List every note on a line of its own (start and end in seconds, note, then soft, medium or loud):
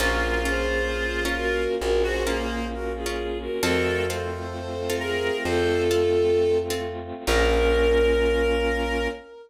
0.00 1.67 A#1 medium
0.00 3.59 A#3 medium
0.00 0.36 C#4 loud
0.00 3.59 C#4 medium
0.00 0.36 F4 loud
0.00 1.64 F4 loud
0.00 3.59 F4 medium
0.00 0.39 F#4 medium
0.00 0.36 A#4 loud
0.00 0.39 A#4 medium
0.45 0.82 C#4 medium
0.45 0.82 F4 loud
0.45 1.24 G#4 medium
0.45 0.82 A#4 medium
0.45 1.24 C5 medium
1.25 1.61 C#4 loud
1.25 1.61 F4 loud
1.25 1.61 A#4 loud
1.37 1.75 F#4 medium
1.37 1.75 A#4 medium
1.81 3.49 A#1 medium
1.81 2.02 F#4 medium
1.81 2.02 A#4 medium
2.03 2.23 F#4 loud
2.03 2.67 G#4 medium
2.03 2.67 C5 medium
2.27 2.65 A#3 medium
2.27 2.63 C#4 loud
2.27 2.63 F4 loud
2.27 2.63 A#4 loud
2.72 2.92 F#4 medium
2.72 2.92 A#4 medium
2.96 3.38 F4 medium
2.96 3.38 G#4 medium
3.06 3.42 C#4 medium
3.06 3.42 F4 loud
3.06 3.42 A#4 medium
3.41 3.62 F#4 medium
3.41 3.62 A#4 medium
3.63 5.30 F2 medium
3.63 7.23 A3 medium
3.63 3.99 C4 loud
3.63 7.23 C4 medium
3.63 3.99 F4 loud
3.63 7.23 F4 medium
3.63 4.06 F#4 medium
3.63 3.99 A4 loud
3.63 4.05 A4 loud
3.63 4.06 A#4 medium
4.08 4.46 C4 loud
4.08 4.46 F4 loud
4.08 4.96 A4 medium
4.08 4.46 A4 medium
4.08 4.96 C5 medium
4.90 5.26 C4 loud
4.90 5.26 F4 loud
4.90 5.26 A4 medium
4.99 5.37 G#4 medium
4.99 5.43 A#4 medium
5.45 7.12 F2 medium
5.45 6.58 F4 medium
5.45 6.58 A4 medium
5.45 5.83 C5 medium
5.91 6.27 C4 loud
5.91 6.27 F4 medium
5.91 6.27 A4 loud
6.70 7.07 C4 loud
6.70 7.07 F4 loud
6.70 7.07 A4 loud
7.27 9.08 A#1 loud
7.27 9.08 A#3 loud
7.27 9.08 C#4 medium
7.27 9.08 C#4 loud
7.27 9.08 F4 loud
7.27 9.07 A#4 loud
7.27 9.08 A#4 medium